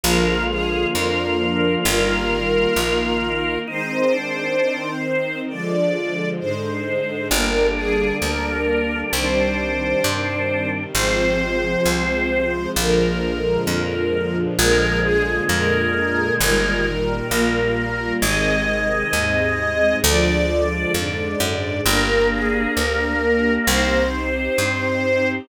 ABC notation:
X:1
M:4/4
L:1/8
Q:1/4=66
K:Eb
V:1 name="String Ensemble 1"
B A B2 B4 | c4 d2 c2 | B A B2 c4 | c4 B4 |
B A B2 B4 | e4 d2 d2 | B A B2 c4 |]
V:2 name="Drawbar Organ"
F8 | E D2 z5 | D8 | C4 z4 |
A,6 B,2 | A,4 z4 | B,6 C2 |]
V:3 name="String Ensemble 1"
[D,F,A,B,]2 [D,F,B,D]2 [E,G,B,]2 [E,B,E]2 | [E,A,C]2 [E,CE]2 [D,F,A,]2 [A,,D,A,]2 | [D,G,B,]4 [C,E,G,]4 | [C,F,A,]4 [B,,D,F,A,]4 |
[B,,D,F,A,]2 [B,,D,A,B,]2 [B,,E,G,]2 [B,,G,B,]2 | [C,E,A,]2 [A,,C,A,]2 [D,F,A,]2 [A,,D,A,]2 | [B,DG]4 [CEG]4 |]
V:4 name="Electric Bass (finger)" clef=bass
B,,,2 F,,2 G,,,2 B,,,2 | z8 | G,,,2 D,,2 C,,2 G,,2 | A,,,2 C,,2 B,,,2 F,,2 |
B,,,2 F,,2 G,,,2 B,,,2 | A,,,2 E,,2 D,,2 F,, _G,, | G,,,2 D,,2 C,,2 G,,2 |]